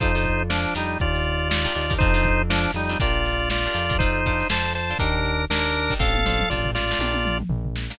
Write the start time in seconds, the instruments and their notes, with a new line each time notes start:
0.00 synth bass 1 F2, acoustic guitar (steel) D4 F4 A4 C5, drawbar organ D#4 C5, kick, closed hi-hat
0.15 acoustic guitar (steel) D4 F4 A4 C5, closed hi-hat
0.25 kick, closed hi-hat
0.39 closed hi-hat
0.50 drawbar organ F3 D4, snare
0.65 closed hi-hat
0.75 synth bass 1 F2, drawbar organ G3 D#4, acoustic guitar (steel) D4 D#4 G4 A#4, closed hi-hat
0.90 closed hi-hat
1.00 synth bass 1 D#2, drawbar organ F4 D5, kick, closed hi-hat
1.15 snare, closed hi-hat
1.24 closed hi-hat
1.39 closed hi-hat
1.49 drawbar organ F4 D5, snare
1.64 acoustic guitar (steel) D4 D#4 G4 A#4, closed hi-hat
1.74 synth bass 1 D#2, acoustic guitar (steel) D4 D#4 G4 A#4, closed hi-hat
1.90 acoustic guitar (steel) D4 D#4 G4 A#4, kick, closed hi-hat
1.98 synth bass 1 F2, acoustic guitar (steel) C4 D4 F4 A4, drawbar organ D#4 C5, kick, closed hi-hat
2.14 acoustic guitar (steel) C4 D4 F4 A4, closed hi-hat
2.24 kick, closed hi-hat
2.39 closed hi-hat
2.50 drawbar organ F3 D4, snare
2.64 snare, closed hi-hat
2.74 synth bass 1 F2, drawbar organ G3 D#4, closed hi-hat
2.89 acoustic guitar (steel) C4 D4 F4 A4, snare, closed hi-hat
3.00 synth bass 1 A#1, acoustic guitar (steel) D4 F4 G4 A#4, drawbar organ F4 D5, kick, closed hi-hat
3.15 closed hi-hat
3.25 snare, closed hi-hat
3.40 closed hi-hat
3.50 drawbar organ F4 D5, snare
3.65 acoustic guitar (steel) D4 F4 G4 A#4, closed hi-hat
3.74 synth bass 1 F2, acoustic guitar (steel) D4 F4 G4 A#4, closed hi-hat
3.89 acoustic guitar (steel) D4 F4 G4 A#4, kick, closed hi-hat
3.99 acoustic guitar (steel) D4 F4 A4 C5, drawbar organ D#4 C5, kick, closed hi-hat
4.15 closed hi-hat
4.26 acoustic guitar (steel) D4 F4 A4 C5, kick, closed hi-hat
4.39 snare, closed hi-hat
4.49 synth bass 1 F2, acoustic guitar (steel) D4 F4 A4 C5, drawbar organ C5 A5, snare
4.64 closed hi-hat
4.75 drawbar organ C5 A5, closed hi-hat
4.89 acoustic guitar (steel) D4 F4 A4 C5, snare, closed hi-hat
4.99 synth bass 1 D#2, acoustic guitar (steel) D4 D#4 G4 A#4, drawbar organ D4 A#4, kick, closed hi-hat
5.15 closed hi-hat
5.25 snare, closed hi-hat
5.40 closed hi-hat
5.50 synth bass 1 D#2, drawbar organ D4 A#4, snare
5.66 closed hi-hat
5.76 closed hi-hat
5.90 acoustic guitar (steel) D4 D#4 G4 A#4, kick, snare, open hi-hat
5.99 synth bass 1 A1, acoustic guitar (steel) C4 D4 F4 A4, drawbar organ A4 F5, kick
6.14 high tom
6.24 acoustic guitar (steel) C4 D4 F4 A4, mid tom
6.40 mid tom
6.50 synth bass 1 A1, acoustic guitar (steel) C4 D4 F4 A4, drawbar organ F4 D5, floor tom
6.65 floor tom
6.75 drawbar organ F4 D5, snare
6.90 acoustic guitar (steel) C4 D4 F4 A4, snare
6.99 synth bass 1 A#1, acoustic guitar (steel) D4 F4 G4 A#4, high tom
7.14 high tom
7.25 mid tom
7.40 mid tom
7.49 synth bass 1 A#1, floor tom
7.65 floor tom
7.76 snare
7.90 acoustic guitar (steel) D4 F4 G4 A#4, snare